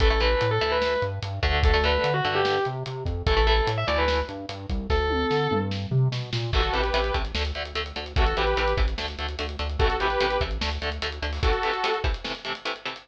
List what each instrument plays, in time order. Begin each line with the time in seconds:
0.00 synth bass 1 A1, overdriven guitar E3 A3, distortion guitar A4, kick, closed hi-hat
0.10 overdriven guitar E3 A3
0.20 overdriven guitar E3 A3, distortion guitar B4, closed hi-hat
0.41 synth bass 1 A2, closed hi-hat
0.51 distortion guitar A4
0.61 synth bass 1 D2, overdriven guitar E3 A3, closed hi-hat
0.72 distortion guitar B4
0.82 snare
1.02 synth bass 1 G2, closed hi-hat
1.22 synth bass 1 G2, closed hi-hat
1.43 synth bass 1 D2, overdriven guitar D3 A3, kick, closed hi-hat
1.63 distortion guitar A4, kick, closed hi-hat
1.74 overdriven guitar D3 A3
1.84 overdriven guitar D3 A3, distortion guitar B4, closed hi-hat
2.04 synth bass 1 D3, closed hi-hat
2.14 distortion guitar F#4
2.25 synth bass 1 G2, overdriven guitar D3 A3, closed hi-hat
2.35 distortion guitar G4
2.45 snare
2.65 synth bass 1 C3, closed hi-hat
2.86 synth bass 1 C3, closed hi-hat
3.05 synth bass 1 F2, kick, closed hi-hat
3.27 synth bass 1 A1, overdriven guitar E3 A3, distortion guitar A4, kick, closed hi-hat
3.37 overdriven guitar E3 A3
3.47 overdriven guitar E3 A3, distortion guitar A4, closed hi-hat
3.67 synth bass 1 A2, closed hi-hat
3.78 distortion guitar E5
3.87 synth bass 1 D2, overdriven guitar E3 A3, distortion guitar D5, closed hi-hat
3.98 distortion guitar B4
4.08 snare
4.29 synth bass 1 G2, closed hi-hat
4.49 synth bass 1 G2, closed hi-hat
4.69 synth bass 1 C2, kick, closed hi-hat
4.90 synth bass 1 D2, distortion guitar A4, kick, snare
5.10 high tom
5.30 synth bass 1 D3, snare
5.51 synth bass 1 G2, mid tom
5.71 snare
5.91 synth bass 1 C3, floor tom
6.12 synth bass 1 B2, snare
6.33 synth bass 1 A#2, snare
6.53 synth bass 1 A1, overdriven guitar C3 E3 A3, lead 2 (sawtooth) F#4 A4, kick, crash
6.63 closed hi-hat
6.73 synth bass 1 A1, overdriven guitar C3 E3 A3, lead 2 (sawtooth) G4 B4, closed hi-hat
6.84 closed hi-hat
6.94 synth bass 1 A1, overdriven guitar C3 E3 A3, closed hi-hat
7.04 closed hi-hat
7.14 synth bass 1 A1, overdriven guitar C3 E3 A3, kick, closed hi-hat
7.25 closed hi-hat
7.35 synth bass 1 D2, overdriven guitar D3 A3, snare
7.45 closed hi-hat
7.55 synth bass 1 D2, overdriven guitar D3 A3, closed hi-hat
7.65 closed hi-hat
7.75 synth bass 1 D2, overdriven guitar D3 A3, closed hi-hat
7.86 closed hi-hat
7.96 synth bass 1 D2, overdriven guitar D3 A3, closed hi-hat
8.06 closed hi-hat
8.16 synth bass 1 A1, overdriven guitar C3 E3 A3, lead 2 (sawtooth) F#4 A4, kick, closed hi-hat
8.26 closed hi-hat
8.37 synth bass 1 A1, overdriven guitar C3 E3 A3, lead 2 (sawtooth) G4 B4, closed hi-hat
8.47 closed hi-hat
8.57 synth bass 1 A1, overdriven guitar C3 E3 A3, closed hi-hat
8.68 closed hi-hat
8.77 synth bass 1 A1, overdriven guitar C3 E3 A3, kick, closed hi-hat
8.88 closed hi-hat
8.98 synth bass 1 D2, overdriven guitar D3 A3, snare
9.08 closed hi-hat
9.18 synth bass 1 D2, overdriven guitar D3 A3, closed hi-hat
9.28 closed hi-hat
9.39 synth bass 1 D2, overdriven guitar D3 A3, closed hi-hat
9.49 closed hi-hat
9.59 synth bass 1 D2, overdriven guitar D3 A3, closed hi-hat
9.69 closed hi-hat
9.79 synth bass 1 A1, overdriven guitar C3 E3 A3, lead 2 (sawtooth) F#4 A4, kick, closed hi-hat
9.90 closed hi-hat
10.00 synth bass 1 A1, overdriven guitar C3 E3 A3, lead 2 (sawtooth) G4 B4, closed hi-hat
10.10 closed hi-hat
10.20 synth bass 1 A1, overdriven guitar C3 E3 A3, closed hi-hat
10.30 closed hi-hat
10.41 synth bass 1 A1, overdriven guitar C3 E3 A3, kick, closed hi-hat
10.51 closed hi-hat
10.61 synth bass 1 D2, overdriven guitar D3 A3, snare
10.71 closed hi-hat
10.82 synth bass 1 D2, overdriven guitar D3 A3, closed hi-hat
10.92 closed hi-hat
11.02 synth bass 1 D2, overdriven guitar D3 A3, closed hi-hat
11.12 closed hi-hat
11.22 synth bass 1 D2, overdriven guitar D3 A3, closed hi-hat
11.33 open hi-hat
11.43 overdriven guitar C3 E3 A3, lead 2 (sawtooth) F#4 A4, kick, closed hi-hat
11.53 closed hi-hat
11.63 overdriven guitar C3 E3 A3, closed hi-hat
11.73 closed hi-hat
11.84 overdriven guitar C3 E3 A3, closed hi-hat
11.94 closed hi-hat
12.04 overdriven guitar C3 E3 A3, kick, closed hi-hat
12.14 closed hi-hat
12.24 overdriven guitar C3 E3 A3, snare
12.35 closed hi-hat
12.45 overdriven guitar C3 E3 A3, closed hi-hat
12.55 closed hi-hat
12.65 overdriven guitar C3 E3 A3, closed hi-hat
12.76 closed hi-hat
12.85 overdriven guitar C3 E3 A3, closed hi-hat
12.96 closed hi-hat